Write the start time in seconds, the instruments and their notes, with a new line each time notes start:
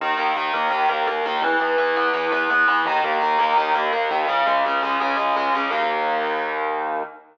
0.01 synth bass 1 D#2, overdriven guitar D#3
0.17 synth bass 1 D#2, overdriven guitar A#3
0.36 synth bass 1 D#2, overdriven guitar D#3
0.53 synth bass 1 D#2, overdriven guitar A#3
0.71 synth bass 1 D#2, overdriven guitar D#3
0.89 synth bass 1 D#2, overdriven guitar A#3
1.07 synth bass 1 D#2, overdriven guitar A#3
1.26 synth bass 1 D#2, overdriven guitar D#3
1.42 synth bass 1 E2, overdriven guitar E3
1.60 synth bass 1 E2, overdriven guitar B3
1.78 synth bass 1 E2, overdriven guitar E3
1.96 synth bass 1 E2, overdriven guitar B3
2.14 synth bass 1 E2, overdriven guitar E3
2.32 synth bass 1 E2, overdriven guitar B3
2.50 synth bass 1 E2, overdriven guitar B3
2.68 synth bass 1 E2, overdriven guitar E3
2.85 synth bass 1 D#2, overdriven guitar D#3
3.04 synth bass 1 D#2, overdriven guitar A#3
3.22 synth bass 1 D#2, overdriven guitar D#3
3.39 synth bass 1 D#2, overdriven guitar A#3
3.57 synth bass 1 D#2, overdriven guitar D#3
3.75 synth bass 1 D#2, overdriven guitar A#3
3.93 synth bass 1 D#2, overdriven guitar A#3
4.10 synth bass 1 D#2, overdriven guitar D#3
4.28 synth bass 1 C#2, overdriven guitar C#3
4.46 synth bass 1 C#2, overdriven guitar G#3
4.65 synth bass 1 C#2, overdriven guitar C#3
4.82 synth bass 1 C#2, overdriven guitar G#3
5.00 synth bass 1 C#2, overdriven guitar C#3
5.17 synth bass 1 C#2, overdriven guitar G#3
5.35 synth bass 1 C#2, overdriven guitar G#3
5.53 synth bass 1 C#2, overdriven guitar C#3
5.71 synth bass 1 D#2, overdriven guitar D#3 A#3